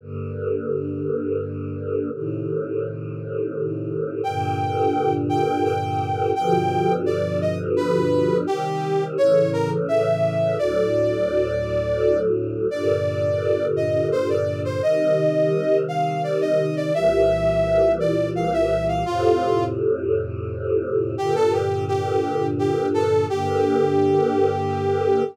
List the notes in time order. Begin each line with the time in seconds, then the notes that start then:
0.01 G2 D3 A#3
2.12 A2 C3 D#3
4.24 G2 A#2 D3 G5
5.29 G5
5.65 G5
6.35 G2 B2 D3 F3 G5
7.06 D5
7.41 D#5
7.76 B4
8.47 C3 D#3 G3 G4
9.17 A2 C#3 E3 C#5
9.53 A#4
9.88 E5
10.58 D2 A2 F#3 D5
12.71 G2 A#2 D3 D5
13.76 D#5
14.12 C5
14.29 D5
14.65 C5
14.82 C3 D#3 G3 D#5
15.88 F5
16.24 D5
16.41 D#5
16.76 D5
16.94 C2 A#2 E3 G3 E5
18.00 D5
18.35 F5
18.53 E5
18.88 F5
19.06 F2 A2 C3 F4
21.17 G2 A#2 D3 G4
21.35 A4
21.53 G4
21.88 G4
22.59 G4
22.94 A4
23.29 G2 D3 A#3 G4